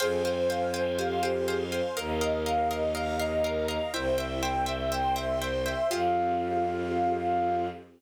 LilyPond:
<<
  \new Staff \with { instrumentName = "Flute" } { \time 4/4 \key f \minor \tempo 4 = 122 aes'8 c''8 f''8 c''8 f''8 c''8 aes'8 c''8 | bes'8 ees''8 f''8 ees''8 f''8 ees''8 bes'8 ees''8 | c''8 e''8 g''8 e''8 g''8 e''8 c''8 e''8 | f''1 | }
  \new Staff \with { instrumentName = "Ocarina" } { \time 4/4 \key f \minor c''2 g'8 g'4 r8 | bes'2 ees''8 ees''4 r8 | e'4. r2 r8 | f'1 | }
  \new Staff \with { instrumentName = "Pizzicato Strings" } { \time 4/4 \key f \minor <c'' f'' g'' aes''>8 <c'' f'' g'' aes''>8 <c'' f'' g'' aes''>8 <c'' f'' g'' aes''>8 <c'' f'' g'' aes''>8 <c'' f'' g'' aes''>8 <c'' f'' g'' aes''>8 <c'' f'' g'' aes''>8 | <bes' ees'' f''>8 <bes' ees'' f''>8 <bes' ees'' f''>8 <bes' ees'' f''>8 <bes' ees'' f''>8 <bes' ees'' f''>8 <bes' ees'' f''>8 <bes' ees'' f''>8 | <c'' e'' g''>8 <c'' e'' g''>8 <c'' e'' g''>8 <c'' e'' g''>8 <c'' e'' g''>8 <c'' e'' g''>8 <c'' e'' g''>8 <c'' e'' g''>8 | <c' f' g' aes'>1 | }
  \new Staff \with { instrumentName = "Violin" } { \clef bass \time 4/4 \key f \minor f,1 | ees,1 | c,1 | f,1 | }
  \new Staff \with { instrumentName = "String Ensemble 1" } { \time 4/4 \key f \minor <c'' f'' g'' aes''>2 <c'' f'' aes'' c'''>2 | <bes' ees'' f''>2 <bes' f'' bes''>2 | <c'' e'' g''>2 <c'' g'' c'''>2 | <c' f' g' aes'>1 | }
>>